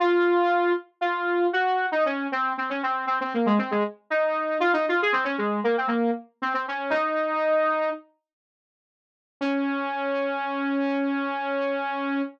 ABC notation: X:1
M:9/8
L:1/16
Q:3/8=78
K:Db
V:1 name="Lead 2 (sawtooth)"
F6 z2 F4 G3 E D2 | C2 C D C2 C C B, A, C A, z2 E4 | F E F A C D A,2 B, C B,2 z2 C C D2 | "^rit." E8 z10 |
D18 |]